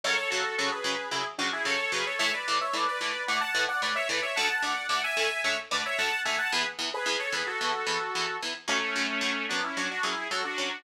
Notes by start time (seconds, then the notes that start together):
0.04 F#2 C#3 F#3 A4 C#5
0.17 A4 C#5
0.30 F#2 C#3 F#3 F#4 A4
0.58 F#2 C#3 F#3 F#4 A4
0.71 G#4 B4
0.84 F#2 C#3 F#3
1.11 F#2 C#3 F#3 E4 G#4
1.38 F#2 C#3 F#3 D4 F#4
1.53 E4 G#4
1.65 F#2 C#3 F#3 A4 C#5
1.92 F#2 C#3 F#3 G#4 B4
2.06 A4 C#5
2.19 A2 E3 A3 C#5 E5
2.34 B4 D5
2.48 A2 E3 A3
2.61 C#5 E5
2.73 A2 E3 A3 B4 D5
2.88 B4 D5
3.01 A2 E3 A3
3.28 A2 E3 A3 D5 F#5
3.41 F#5 A5
3.55 A2 E3 A3
3.68 D5 F#5
3.82 A2 E3 A3 B4 D5
3.95 C#5 E5
4.09 A2 E3 A3 B4 D5
4.22 C#5 E5
4.36 D2 D3 A3 F#5 A5
4.49 F#5 A5
4.63 D2 D3 A3 D5 F#5
4.89 D2 D3 A3 D5 F#5
5.04 E5 G#5
5.17 D2 D3 A3
5.44 D2 D3 A3 C#5 E5
5.71 D2 D3 A3 B4 D5
5.85 C#5 E5
5.98 D2 D3 A3 F#5 A5
6.25 D2 D3 A3 E5 G#5
6.38 F#5 A5
6.52 E2 E3 B3 G#4 B4
6.79 E2 E3 B3
6.93 G#4 B4
7.06 E2 E3 B3 G#4 B4
7.19 A4 C#5
7.32 E2 E3 B3 G#4 B4
7.46 F#4 A4
7.61 E2 E3 B3
7.87 E2 E3 B3
8.15 E2 E3 B3
8.42 E2 E3 B3
8.68 F#2 F#3 A3 C#4
8.96 F#2 F#3 C#4
9.21 F#2 F#3 C#4
9.49 F#2 F#3 B3 C#4 D4
9.64 C#4 E4
9.77 F#2 F#3 C#4 D4 F#4
9.91 D4 F#4
10.03 F#2 F#3 C#4 E4 G#4
10.31 F#2 F#3 C#4 F#4 A4
10.44 D4 F#4
10.58 F#2 F#3 C#4